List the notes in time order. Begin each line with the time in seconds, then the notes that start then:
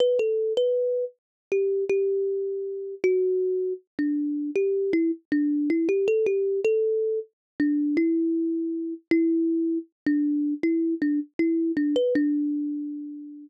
0.00 B4
0.19 A4
0.57 B4
1.52 G4
1.89 G4
3.04 F#4
3.99 D4
4.56 G4
4.93 E4
5.32 D4
5.70 E4
5.89 G4
6.08 A4
6.26 G4
6.65 A4
7.60 D4
7.97 E4
9.11 E4
10.06 D4
10.63 E4
11.02 D4
11.39 E4
11.77 D4
11.96 B4
12.15 D4